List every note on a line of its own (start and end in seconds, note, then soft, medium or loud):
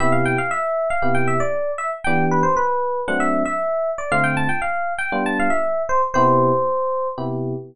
0.00 0.36 C3 medium
0.00 0.36 B3 medium
0.00 0.36 E4 medium
0.00 0.36 G4 medium
0.00 0.12 E5 loud
0.12 0.24 F5 medium
0.25 0.38 G5 loud
0.38 0.50 F5 loud
0.51 0.88 E5 loud
0.90 1.15 F5 loud
1.02 1.38 C3 medium
1.02 1.38 B3 medium
1.02 1.38 E4 medium
1.02 1.38 G4 medium
1.15 1.27 G5 medium
1.28 1.40 E5 loud
1.40 1.71 D5 loud
1.78 1.90 E5 loud
2.04 2.43 E3 medium
2.04 2.43 B3 medium
2.04 2.43 D4 medium
2.04 2.43 G4 medium
2.04 2.25 G5 loud
2.31 2.44 B4 medium
2.43 2.55 C5 medium
2.57 3.01 B4 loud
3.08 3.44 F#3 medium
3.08 3.44 A3 medium
3.08 3.44 C4 medium
3.08 3.44 D4 medium
3.08 3.20 F#5 medium
3.20 3.42 E5 loud
3.46 3.90 E5 loud
3.98 4.10 D5 medium
4.12 4.47 D3 medium
4.12 4.47 A3 medium
4.12 4.47 C4 medium
4.12 4.47 F4 medium
4.12 4.24 F5 loud
4.24 4.36 G5 loud
4.37 4.49 A5 loud
4.49 4.61 G5 medium
4.62 4.93 F5 medium
4.98 5.23 G5 loud
5.12 5.48 G3 medium
5.12 5.48 B3 medium
5.12 5.48 D4 medium
5.12 5.48 F4 medium
5.26 5.38 A5 loud
5.40 5.52 F5 loud
5.50 5.82 E5 medium
5.89 6.01 C5 loud
6.14 6.51 C3 medium
6.14 6.51 B3 medium
6.14 6.51 E4 medium
6.14 6.51 G4 medium
6.14 7.08 C5 loud
7.18 7.54 C3 medium
7.18 7.54 B3 medium
7.18 7.54 E4 medium
7.18 7.54 G4 medium